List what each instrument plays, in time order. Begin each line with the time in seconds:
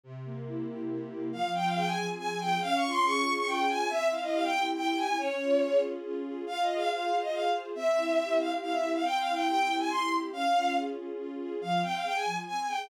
0.04 string ensemble 1 C3
0.25 string ensemble 1 A#3
0.47 string ensemble 1 E4
0.68 string ensemble 1 G4
0.90 string ensemble 1 C3
1.11 string ensemble 1 A#3
1.32 string ensemble 1 F3, violin F5
1.54 string ensemble 1 C4, violin G5
1.65 violin F5
1.75 string ensemble 1 G#4, violin G5
1.86 violin G#5
1.97 string ensemble 1 F3
2.18 string ensemble 1 C4, violin G#5
2.29 violin G#5
2.40 string ensemble 1 G#4, violin G5
2.61 string ensemble 1 C#4, violin F5
2.75 violin C#6
2.82 string ensemble 1 F4
2.90 violin C6
3.04 string ensemble 1 G#4, violin C#6
3.25 string ensemble 1 C#4
3.36 violin C#6
3.47 string ensemble 1 F4, violin G5
3.68 string ensemble 1 G#4, violin G#5
3.89 string ensemble 1 C4, violin E5
4.11 string ensemble 1 E4, violin F5
4.22 violin D#5
4.32 string ensemble 1 G4, violin F5
4.43 violin G5
4.54 string ensemble 1 C4
4.75 string ensemble 1 E4, violin G5
4.86 violin G5
4.97 string ensemble 1 G4, violin G#5
5.18 string ensemble 1 C#4, violin C#5
5.39 string ensemble 1 F4
5.61 string ensemble 1 G#4
5.83 string ensemble 1 C#4
6.04 string ensemble 1 F4
6.25 string ensemble 1 G#4
6.47 string ensemble 1 F4, violin F5
6.61 violin D#5
6.69 string ensemble 1 G#4
6.75 violin F5
6.89 string ensemble 1 C5, violin F5
7.11 string ensemble 1 F4
7.22 violin D#5
7.32 string ensemble 1 G#4, violin F5
7.54 string ensemble 1 C5
7.75 string ensemble 1 C4, violin E5
7.96 string ensemble 1 E4
8.18 string ensemble 1 G4
8.39 string ensemble 1 C4, violin F5
8.61 string ensemble 1 E4, violin F5
8.72 violin E5
8.83 string ensemble 1 G4
8.93 violin F5
9.04 string ensemble 1 C4, violin G5
9.18 violin F5
9.26 string ensemble 1 E4
9.32 violin G5
9.47 string ensemble 1 G4, violin G5
9.68 string ensemble 1 C4
9.79 violin G#5
9.90 string ensemble 1 E4, violin C6
10.11 string ensemble 1 G4
10.32 string ensemble 1 C#4, violin F5
10.54 string ensemble 1 F4
10.75 string ensemble 1 G#4
10.97 string ensemble 1 C#4
11.18 string ensemble 1 F4
11.39 string ensemble 1 G#4
11.61 string ensemble 1 F3, violin F5
11.82 string ensemble 1 C4, violin G5
11.93 violin F5
12.04 string ensemble 1 G#4, violin G5
12.15 violin G#5
12.25 string ensemble 1 F3
12.47 string ensemble 1 C4, violin G#5
12.57 violin G#5
12.68 string ensemble 1 G#4, violin G5